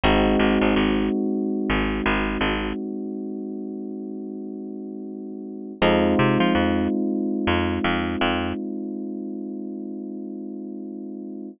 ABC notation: X:1
M:4/4
L:1/16
Q:"Swing 16ths" 1/4=83
K:Db
V:1 name="Electric Bass (finger)" clef=bass
A,,,2 A,,, A,,, A,,,5 A,,,2 A,,,2 A,,,3- | A,,,16 | F,,2 C, F, F,,5 F,,2 F,,2 F,,3- | F,,16 |]
V:2 name="Electric Piano 1"
[A,CEG]16- | [A,CEG]16 | [A,CEF]16- | [A,CEF]16 |]